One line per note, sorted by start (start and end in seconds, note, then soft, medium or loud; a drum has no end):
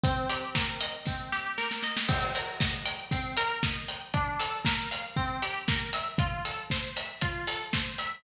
0.04 1.06 C4 loud
0.04 kick loud
0.04 closed hi-hat medium
0.29 1.32 G4 medium
0.29 open hi-hat medium
0.55 1.57 A#4 medium
0.55 kick medium
0.55 snare loud
0.81 1.83 D#5 medium
0.81 open hi-hat medium
1.05 2.04 C4 medium
1.05 kick medium
1.05 snare medium
1.32 2.05 G4 medium
1.32 snare medium
1.58 2.06 A#4 loud
1.58 snare medium
1.71 snare medium
1.83 2.08 D#5 medium
1.83 snare medium
1.97 snare loud
2.09 2.34 C4 loud
2.09 kick loud
2.09 crash loud
2.35 2.61 A#4 medium
2.35 open hi-hat medium
2.60 2.86 D#5 medium
2.60 kick medium
2.60 snare loud
2.85 3.11 G5 medium
2.85 open hi-hat medium
3.11 3.37 C4 loud
3.11 kick medium
3.11 closed hi-hat medium
3.37 3.63 A#4 loud
3.37 open hi-hat medium
3.63 3.89 D#5 medium
3.63 kick medium
3.63 snare loud
3.88 4.13 G5 medium
3.88 open hi-hat medium
4.14 4.40 D4 loud
4.14 kick medium
4.14 closed hi-hat medium
4.40 4.65 A4 medium
4.40 open hi-hat medium
4.65 4.91 A#4 medium
4.65 kick medium
4.65 snare loud
4.91 5.16 F5 medium
4.91 open hi-hat medium
5.16 5.42 C4 loud
5.16 kick medium
5.42 5.68 G4 medium
5.42 open hi-hat medium
5.68 5.94 A#4 medium
5.68 kick medium
5.68 snare loud
5.93 6.18 E5 loud
5.93 open hi-hat medium
6.18 6.45 F4 loud
6.18 kick loud
6.18 closed hi-hat loud
6.45 6.71 A4 medium
6.45 open hi-hat medium
6.70 6.97 C5 loud
6.70 kick medium
6.70 snare loud
6.96 7.22 E5 medium
6.96 open hi-hat medium
7.21 7.48 F4 loud
7.21 kick medium
7.21 closed hi-hat loud
7.47 7.73 A4 medium
7.47 open hi-hat medium
7.73 7.99 C5 medium
7.73 kick medium
7.73 snare loud
7.98 8.23 E5 medium
7.98 open hi-hat medium